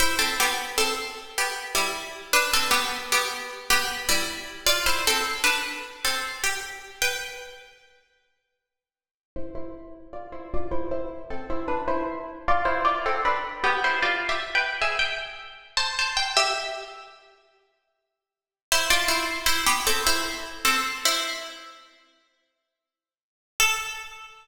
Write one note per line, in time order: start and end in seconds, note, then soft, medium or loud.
0.00 0.18 E4 medium
0.00 0.18 C5 medium
0.19 0.37 C4 medium
0.19 0.37 A4 medium
0.40 0.74 B3 medium
0.40 0.74 G4 medium
0.78 1.32 C4 medium
0.78 1.32 A4 medium
1.38 1.73 B3 medium
1.38 1.73 G4 medium
1.75 2.26 G3 medium
1.75 2.26 E4 medium
2.33 2.52 D4 medium
2.33 2.52 B4 medium
2.53 2.72 C4 medium
2.53 2.72 A4 medium
2.71 3.03 B3 medium
2.71 3.03 G4 medium
3.12 3.60 B3 medium
3.12 3.60 G4 medium
3.70 4.03 B3 medium
3.70 4.03 G4 medium
4.09 4.65 G3 medium
4.09 4.65 E4 medium
4.67 4.85 F4 medium
4.67 4.85 D5 medium
4.86 5.05 E4 medium
4.86 5.05 C5 medium
5.07 5.42 C4 medium
5.07 5.42 A4 medium
5.44 6.01 D4 medium
5.44 6.01 B4 medium
6.05 6.38 C4 medium
6.05 6.38 A4 medium
6.44 6.93 G4 medium
7.02 7.69 B4 medium
7.02 7.69 G5 medium
9.36 9.55 E4 medium
9.36 9.55 C5 medium
9.55 10.07 E4 medium
9.55 10.07 C5 medium
10.13 10.31 F4 medium
10.13 10.31 D5 medium
10.32 10.51 E4 medium
10.32 10.51 C5 medium
10.54 10.72 F4 medium
10.54 10.72 D5 medium
10.71 10.90 E4 medium
10.71 10.90 C5 medium
10.91 11.25 E4 medium
10.91 11.25 C5 medium
11.30 11.49 C4 medium
11.30 11.49 A4 medium
11.50 11.68 E4 medium
11.50 11.68 C5 medium
11.68 11.86 D4 medium
11.68 11.86 B4 medium
11.88 12.44 E4 medium
11.88 12.44 C5 medium
12.48 12.67 F4 medium
12.48 12.67 D5 loud
12.65 12.84 E4 medium
12.65 12.84 C5 medium
12.85 13.03 F4 medium
12.85 13.03 D5 medium
13.06 13.24 C4 medium
13.06 13.24 A4 medium
13.25 13.56 D4 medium
13.25 13.56 B4 medium
13.64 13.82 B3 medium
13.64 13.82 G4 medium
13.84 14.03 E4 medium
13.84 14.03 C5 medium
14.02 14.27 F4 medium
14.02 14.27 D5 medium
14.29 14.54 G4 medium
14.29 14.54 E5 medium
14.55 14.80 B4 medium
14.55 14.80 G5 medium
14.81 15.00 G#4 medium
14.81 15.00 E5 medium
14.99 15.65 G5 medium
15.77 15.96 C5 medium
15.77 15.96 A5 medium
15.99 16.17 C5 medium
15.99 16.17 A5 medium
16.17 16.35 G5 medium
16.37 17.03 G4 medium
16.37 17.03 E5 medium
18.72 18.90 E4 medium
18.72 18.90 C5 medium
18.90 19.09 F4 medium
18.90 19.09 D5 medium
19.08 19.46 E4 medium
19.08 19.46 C5 medium
19.46 19.65 E4 medium
19.46 19.65 C5 medium
19.66 19.85 B3 medium
19.66 19.85 G4 medium
19.87 20.05 C4 medium
19.87 20.05 A4 medium
20.07 20.25 E4 medium
20.07 20.25 C5 medium
20.65 20.83 C4 medium
20.65 20.83 A4 medium
21.05 22.62 E4 medium
21.05 22.62 C5 medium
23.60 24.47 A4 loud